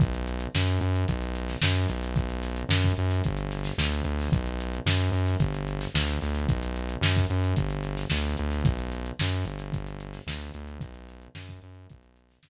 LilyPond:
<<
  \new Staff \with { instrumentName = "Synth Bass 1" } { \clef bass \time 4/4 \key b \minor \tempo 4 = 111 b,,4 fis,8 fis,8 b,,4 fis,8 b,,8~ | b,,4 fis,8 fis,8 g,,4 d,8 d,8 | b,,4 fis,8 fis,8 g,,4 d,8 d,8 | b,,4 fis,8 fis,8 g,,4 d,8 d,8 |
b,,4 fis,8 g,,4. d,8 d,8 | b,,4 fis,8 fis,8 b,,4 fis,8 r8 | }
  \new DrumStaff \with { instrumentName = "Drums" } \drummode { \time 4/4 <hh bd>16 hh16 hh16 hh16 sn16 <hh sn>16 hh16 hh16 <hh bd>16 hh16 hh16 <hh sn>16 sn16 hh16 <hh sn>16 hh16 | <hh bd>16 hh16 <hh sn>16 hh16 sn16 <hh bd>16 hh16 <hh sn>16 <hh bd>16 hh16 <hh sn>16 <hh sn>16 sn16 hh16 hh16 hho16 | <hh bd>16 hh16 hh16 hh16 sn16 <hh sn>16 hh16 <hh sn>16 <hh bd>16 hh16 hh16 <hh sn>16 sn16 <hh sn>16 <hh sn>16 <hh sn>16 | <hh bd>16 hh16 hh16 hh16 sn16 <hh bd>16 hh16 hh16 <hh bd>16 hh16 hh16 <hh sn>16 sn16 hh16 hh16 <hh sn>16 |
<hh bd>16 hh16 hh16 hh16 sn16 hh16 hh16 hh16 <hh bd>16 hh16 hh16 <hh sn>16 sn16 hh16 hh16 hh16 | <hh bd>16 hh16 hh16 hh16 sn16 <hh bd sn>16 hh16 hh16 <hh bd>16 hh16 hh16 <hh sn>16 sn4 | }
>>